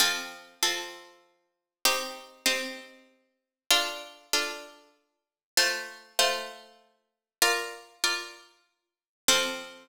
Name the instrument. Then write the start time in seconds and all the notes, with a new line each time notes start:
harpsichord
0.00 F3 C4 A4
0.63 F3 C4 A4
1.85 C4 D#4 G4
2.46 C4 D#4 G4
3.70 D4 F4 A4
4.33 D4 F4 A4
5.57 A3 F4 C5
6.19 A3 F4 C5
7.42 F4 A#4 D5
8.04 F4 A#4 D5
9.28 F3 C4 A4